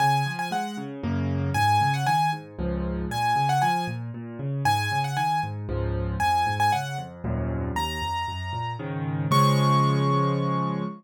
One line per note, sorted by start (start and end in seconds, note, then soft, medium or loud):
0.00 0.23 C#3 medium
0.00 0.32 G#5 medium
0.26 0.49 F3 medium
0.39 0.51 G#5 medium
0.51 0.74 G#3 medium
0.51 0.76 F#5 medium
0.77 1.01 C#3 medium
1.03 1.50 F#2 medium
1.03 1.50 C#3 medium
1.03 1.50 A#3 medium
1.54 1.78 G#2 medium
1.54 1.92 G#5 loud
1.81 2.05 C#3 medium
1.94 2.06 F#5 medium
2.06 2.30 D#3 medium
2.06 2.30 G#5 medium
2.33 2.56 G#2 medium
2.59 3.05 C#2 medium
2.59 3.05 G#2 medium
2.59 3.05 F3 medium
3.10 3.33 A#2 medium
3.10 3.48 G#5 medium
3.36 3.59 C#3 medium
3.49 3.61 F#5 medium
3.62 3.86 F3 medium
3.62 3.86 G#5 medium
3.87 4.11 A#2 medium
4.14 4.38 A#2 medium
4.39 4.62 C#3 medium
4.65 4.88 G#2 medium
4.65 4.99 G#5 loud
4.92 5.15 C#3 medium
5.04 5.16 F#5 medium
5.17 5.40 D#3 medium
5.17 5.41 G#5 medium
5.43 5.66 G#2 medium
5.69 6.15 C#2 medium
5.69 6.15 G#2 medium
5.69 6.15 F3 medium
6.20 6.44 F2 medium
6.20 6.55 G#5 medium
6.46 6.70 G#2 medium
6.60 6.72 G#5 medium
6.72 6.96 C#3 medium
6.72 6.97 F#5 medium
6.98 7.21 F2 medium
7.24 7.71 D#2 medium
7.24 7.71 F2 medium
7.24 7.71 F#2 loud
7.24 7.71 A#2 medium
7.76 7.99 D#2 medium
7.76 8.72 A#5 medium
8.02 8.25 F2 medium
8.28 8.51 F#2 medium
8.53 8.76 A#2 medium
8.79 9.26 G#2 medium
8.79 9.26 C#3 medium
8.79 9.26 D#3 medium
9.31 10.83 C#3 loud
9.31 10.83 F3 medium
9.31 10.83 G#3 loud
9.31 10.83 C#6 loud